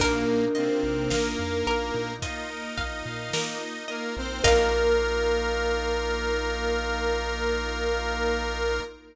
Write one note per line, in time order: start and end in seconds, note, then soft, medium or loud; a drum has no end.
0.00 0.25 A#1 medium
0.00 0.45 A#2 medium
0.00 0.25 A#3 loud
0.00 0.45 A#3 medium
0.00 4.40 A#3 loud
0.00 2.14 D4 medium
0.00 4.40 D#4 medium
0.00 4.40 F4 medium
0.00 2.14 A#4 loud
0.00 0.51 A#4 loud
0.00 kick medium
0.00 crash loud
0.28 0.53 D#4 medium
0.55 1.12 C3 medium
0.55 1.12 C4 medium
0.55 0.81 F4 medium
0.55 1.05 D#5 medium
0.55 closed hi-hat medium
0.83 1.08 A#1 medium
0.83 1.09 A#4 medium
1.10 1.36 A#1 medium
1.10 2.12 A#3 medium
1.10 2.12 A#4 medium
1.10 1.36 D#5 medium
1.10 1.60 F5 medium
1.10 snare loud
1.39 1.64 F2 medium
1.39 1.64 F5 medium
1.67 1.92 A#1 medium
1.67 1.92 A#3 medium
1.67 2.17 A#4 medium
1.67 closed hi-hat medium
1.94 2.19 A#2 medium
1.94 2.20 D#4 medium
2.22 3.84 D#4 medium
2.22 2.47 F4 medium
2.22 2.72 D#5 loud
2.22 3.84 D#5 medium
2.22 kick medium
2.22 closed hi-hat loud
2.50 2.75 A#4 medium
2.78 3.03 A#1 medium
2.78 3.03 D#5 medium
2.78 3.28 F5 medium
2.78 kick medium
2.78 snare soft
2.78 closed hi-hat medium
3.06 3.31 A#2 medium
3.06 3.31 F5 medium
3.33 3.58 A#3 medium
3.33 3.84 A#4 medium
3.33 snare loud
3.61 3.86 D#4 medium
3.88 4.15 A#3 medium
3.88 4.14 F4 medium
3.88 4.15 A#4 medium
3.88 4.38 D#5 medium
3.88 closed hi-hat medium
4.17 4.42 A#1 medium
4.17 4.44 C4 medium
4.17 4.42 A#4 medium
4.17 4.44 C5 medium
4.44 8.80 A#1 loud
4.44 8.80 A#3 loud
4.44 8.80 D#4 medium
4.44 8.80 D#4 loud
4.44 8.80 F4 medium
4.44 8.80 F4 loud
4.44 8.79 A#4 loud
4.44 8.80 A#4 loud
4.44 8.81 A#4 loud
4.44 8.80 D#5 loud
4.44 8.80 F5 loud
4.44 kick loud
4.44 crash loud